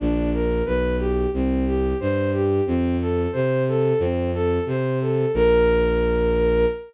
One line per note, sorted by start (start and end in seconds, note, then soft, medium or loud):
0.00 0.62 A#1 loud
0.00 0.30 D4 medium
0.33 0.63 A#4 medium
0.65 1.27 B1 medium
0.65 0.96 B4 medium
0.99 1.30 G4 medium
1.34 1.94 C2 medium
1.34 1.65 C4 medium
1.66 1.97 G4 medium
2.00 2.61 G2 medium
2.00 2.31 C5 medium
2.33 2.64 G4 medium
2.66 3.27 F2 medium
2.66 2.97 C4 medium
3.00 3.31 A4 medium
3.32 3.93 C3 medium
3.32 3.63 C5 medium
3.68 3.99 A4 medium
3.99 4.59 F2 medium
3.99 4.31 C4 medium
4.34 4.64 A4 medium
4.66 5.26 C3 medium
4.66 4.99 C5 medium
5.01 5.32 A4 medium
5.34 6.65 A#1 loud
5.34 6.65 A#4 loud